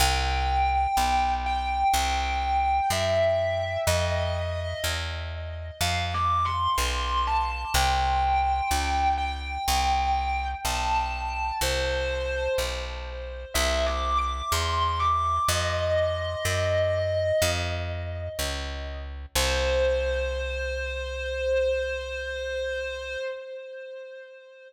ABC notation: X:1
M:4/4
L:1/8
Q:1/4=62
K:C
V:1 name="Distortion Guitar"
g3 g3 e2 | _e2 z2 (3f d' c' c' a | g3 g3 a2 | c2 z2 (3e d' d' c' d' |
_e4 z4 | c8 |]
V:2 name="Electric Bass (finger)" clef=bass
C,,2 B,,,2 C,,2 ^F,,2 | F,,2 E,,2 F,,2 B,,,2 | C,,2 ^C,,2 =C,,2 B,,,2 | C,,2 B,,,2 C,,2 E,,2 |
F,,2 ^F,,2 =F,,2 ^C,,2 | C,,8 |]